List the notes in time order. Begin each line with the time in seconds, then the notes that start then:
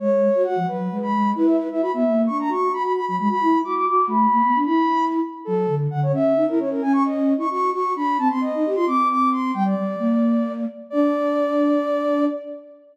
0.00 G#3 C#5
0.35 F#4
0.44 F#4 F#5
0.56 F3
0.67 F#3 B4
0.92 G#3
1.02 B5
1.14 G#3
1.35 E4 B4
1.47 E5
1.59 B4
1.70 E4 E5
1.81 F#4 B5
1.94 B3 E5
2.06 A#3
2.26 D4 C#6
2.40 A#5
2.49 F#4 C#6
2.71 F#4 B5
2.83 B5
2.95 B5
3.06 F#3 B5
3.19 G#3 B5
3.29 F#4 B5
3.41 E4
3.64 F#4 D6
3.75 D6
3.86 F#4 D6
4.07 A3 B5
4.32 A#3
4.44 B3
4.55 D4
4.65 E4 B5
5.45 F#3 A4
5.68 D3
5.91 D3 F#5
6.03 C#5
6.12 C#4 E5
6.36 D#4
6.49 E4 A#4
6.59 C#4 C#5
6.71 A#4
6.82 C#4 G#5
6.93 C#6
7.05 D#5
7.37 E4 C#6
7.51 F#4 C#6
7.73 F#4 C#6
7.96 D4 B5
8.18 C4 A5
8.30 C4 C6
8.41 D#5
8.55 D#4
8.66 G4
8.75 F4 C6
8.87 C4 D6
9.10 D6
9.31 C6
9.54 G3 G5
9.65 D5
9.77 G3
9.99 A#3
10.90 D4 D5